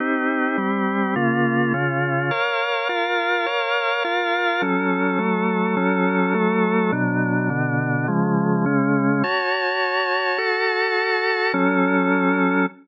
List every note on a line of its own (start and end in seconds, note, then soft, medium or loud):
0.00 0.57 C4 medium
0.00 0.57 D#4 medium
0.00 0.57 G4 medium
0.57 1.15 G3 loud
0.57 1.15 C4 medium
0.57 1.15 G4 medium
1.16 1.73 C#3 medium
1.16 1.73 A#3 medium
1.16 1.73 F4 loud
1.73 2.31 C#3 loud
1.73 2.31 C#4 medium
1.73 2.31 F4 medium
2.31 2.88 A#4 medium
2.31 2.88 C#5 medium
2.31 2.88 F5 medium
2.89 3.46 F4 medium
2.89 3.46 A#4 medium
2.89 3.46 F5 medium
3.46 4.03 A#4 loud
3.46 4.03 C#5 loud
3.46 4.03 F5 medium
4.04 4.61 F4 medium
4.04 4.61 A#4 medium
4.04 4.61 F5 loud
4.62 5.18 F#3 medium
4.62 5.19 C#4 loud
4.62 5.18 A4 medium
5.18 5.76 F#3 loud
5.18 5.76 A3 medium
5.18 5.76 A4 loud
5.77 6.33 F#3 loud
5.77 6.34 C#4 medium
5.77 6.33 A4 loud
6.34 6.91 F#3 loud
6.34 6.91 A3 loud
6.34 6.91 A4 loud
6.92 7.49 B2 loud
6.92 7.49 F#3 medium
6.92 7.49 D4 medium
7.50 8.07 B2 loud
7.50 8.07 D3 medium
7.50 8.07 D4 medium
8.08 8.65 C#3 medium
8.08 8.65 F3 loud
8.08 8.65 G#3 loud
8.66 9.23 C#3 medium
8.66 9.23 G#3 medium
8.66 9.23 C#4 loud
9.23 10.37 F#4 medium
9.23 10.38 C#5 loud
9.23 10.37 A5 medium
10.38 11.52 F#4 loud
10.38 11.52 A4 loud
10.38 11.52 A5 loud
11.53 12.66 F#3 loud
11.53 12.66 C#4 loud
11.53 12.66 A4 medium